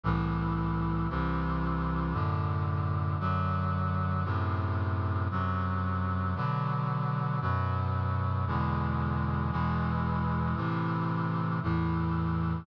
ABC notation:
X:1
M:4/4
L:1/8
Q:1/4=57
K:G
V:1 name="Brass Section" clef=bass
[C,,A,,E,]2 [C,,C,E,]2 [F,,A,,D,]2 [F,,D,F,]2 | [F,,A,,C,]2 [F,,C,F,]2 [B,,D,F,]2 [F,,B,,F,]2 | [E,,B,,D,^G,]2 [E,,B,,E,G,]2 [A,,C,E,]2 [E,,A,,E,]2 |]